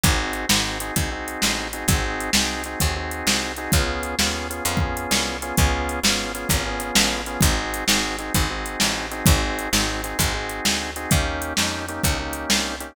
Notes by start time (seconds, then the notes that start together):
0.04 G#1 C4 D#4 F#4 G#4, kick, closed hi-hat
0.33 closed hi-hat
0.49 G#1 C4 D#4 F#4 G#4, snare
0.80 C4 D#4 F#4 G#4, closed hi-hat
0.96 C2 C4 D#4 F#4 G#4, kick, closed hi-hat
1.11 C4 D#4 F#4 G#4
1.28 closed hi-hat
1.42 A1, snare
1.73 C4 D#4 F#4 G#4, closed hi-hat
1.88 G#1 C4 D#4 F#4 G#4, kick, closed hi-hat
2.20 closed hi-hat
2.33 C2 C4 D#4 F#4 G#4, snare
2.64 C4 D#4 F#4 G#4, closed hi-hat
2.80 D#2 C4 D#4 F#4 G#4, kick, closed hi-hat
2.96 C4 D#4 F#4 G#4
3.11 closed hi-hat
3.27 C2, snare
3.57 C4 D#4 F#4 G#4, closed hi-hat
3.72 C#2 B3 C#4 F4 G#4, kick, closed hi-hat
4.03 closed hi-hat
4.19 D#2 B3 C#4 F4 G#4, snare
4.50 B3 C#4 F4 G#4, closed hi-hat
4.65 F2 B3 C#4 F4 G#4, closed hi-hat
4.77 B3 C#4 F4 G#4, kick
4.97 closed hi-hat
5.11 C2, snare
5.42 B3 C#4 F4 G#4, closed hi-hat
5.57 C#2 B3 C#4 F4 G#4, kick, closed hi-hat
5.89 closed hi-hat
6.03 G#1 B3 C#4 F4 G#4, snare
6.35 B3 C#4 F4 G#4, closed hi-hat
6.49 G#1 B3 C#4 F4 G#4, kick, closed hi-hat
6.65 B3 C#4 F4 G#4
6.80 closed hi-hat
6.95 A1, snare
7.26 B3 C#4 F4 G#4, closed hi-hat
7.41 G#1 C4 D#4 F#4 G#4, kick, closed hi-hat
7.74 closed hi-hat
7.88 G#1 C4 D#4 F#4 G#4, snare
8.19 C4 D#4 F#4 G#4, closed hi-hat
8.34 G#1 C4 D#4 F#4 G#4, kick, closed hi-hat
8.50 C4 D#4 F#4 G#4
8.66 closed hi-hat
8.80 A1, snare
9.11 C4 D#4 F#4 G#4, closed hi-hat
9.26 G#1 C4 D#4 F#4 G#4, kick, closed hi-hat
9.59 closed hi-hat
9.73 G#1 C4 D#4 F#4 G#4, snare
10.04 C4 D#4 F#4 G#4, closed hi-hat
10.19 G#1 C4 D#4 F#4 G#4, kick, closed hi-hat
10.34 C4 D#4 F#4 G#4
10.49 closed hi-hat
10.65 D2, snare
10.96 C4 D#4 F#4 G#4, closed hi-hat
11.11 D#2 A#3 C#4 D#4 G4, kick, closed hi-hat
11.42 closed hi-hat
11.57 F2 A#3 C#4 D#4 G4, snare
11.88 A#3 C#4 D#4 G4, closed hi-hat
12.04 C#2 A#3 C#4 D#4 G4, kick, closed hi-hat
12.19 A#3 C#4 D#4 G4
12.33 closed hi-hat
12.50 C2, snare
12.80 A#3 C#4 D#4 G4, closed hi-hat